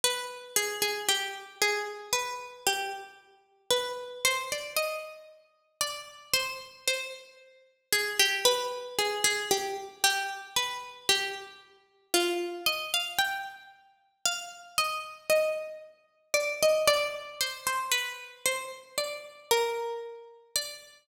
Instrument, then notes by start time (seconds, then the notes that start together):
pizzicato strings
0.04 B4
0.56 G#4
0.82 G#4
1.09 G4
1.62 G#4
2.13 B4
2.67 G4
3.70 B4
4.25 C5
4.52 D5
4.77 D#5
5.81 D5
6.34 C5
6.88 C5
7.93 G#4
8.20 G4
8.45 B4
8.99 G#4
9.24 G#4
9.51 G4
10.04 G4
10.56 B4
11.09 G4
12.14 F4
12.66 D#5
12.94 F5
13.19 G5
14.25 F5
14.78 D#5
15.30 D#5
16.34 D5
16.63 D#5
16.88 D5
17.41 C5
17.67 C5
17.91 B4
18.46 C5
18.98 D5
19.51 A#4
20.56 D5